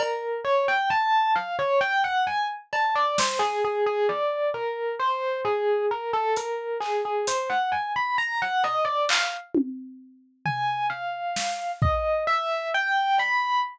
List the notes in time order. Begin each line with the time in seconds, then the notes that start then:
0.00 A#4, cowbell
0.45 C#5
0.68 G5
0.90 A5
1.35 F5
1.59 C#5
1.81 G5
2.04 F#5
2.27 G#5
2.73 A5, cowbell
2.95 D5
3.18 C5, snare
3.39 G#4
3.65 G#4
3.86 G#4
4.09 D5
4.54 A#4
4.99 C5
5.45 G#4
5.91 A#4
6.13 A4
6.36 A#4, closed hi-hat
6.80 G#4, clap
7.05 G#4
7.27 C5, closed hi-hat
7.50 F#5
7.72 G#5
7.96 B5
8.18 A#5
8.42 F#5
8.64 D#5, cowbell
8.85 D5
9.09 F5, clap
9.55 high tom
10.45 G#5, floor tom
10.90 F5
11.36 snare
11.82 D#5, kick
12.27 E5
12.74 G5
13.18 B5, cowbell